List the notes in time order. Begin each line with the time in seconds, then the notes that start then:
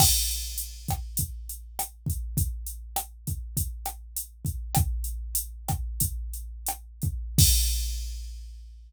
0.00 kick, cross-stick, crash
0.31 closed hi-hat
0.58 closed hi-hat
0.88 kick, cross-stick, closed hi-hat
1.17 kick, closed hi-hat
1.49 closed hi-hat
1.79 cross-stick, closed hi-hat
2.06 kick, closed hi-hat
2.37 kick, closed hi-hat
2.66 closed hi-hat
2.96 cross-stick, closed hi-hat
3.27 kick, closed hi-hat
3.57 kick, closed hi-hat
3.86 cross-stick, closed hi-hat
4.16 closed hi-hat
4.45 kick, closed hi-hat
4.75 kick, cross-stick, closed hi-hat
5.04 closed hi-hat
5.35 closed hi-hat
5.68 kick, cross-stick, closed hi-hat
6.00 kick, closed hi-hat
6.34 closed hi-hat
6.66 cross-stick, closed hi-hat
7.02 kick, closed hi-hat
7.38 kick, crash